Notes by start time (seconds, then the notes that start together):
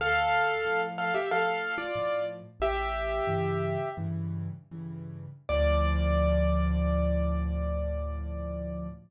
0.00 D2 A4 F5
0.65 A2 F3
0.98 A4 F5
1.14 G4 E5
1.31 A2 F3 A4 F5
1.78 F4 D5
1.96 A2 F3
2.60 A1 G4 E5
3.27 G2 C#3 E3
3.97 G2 C#3 E3
4.71 G2 C#3 E3
5.49 D2 A2 F3 D5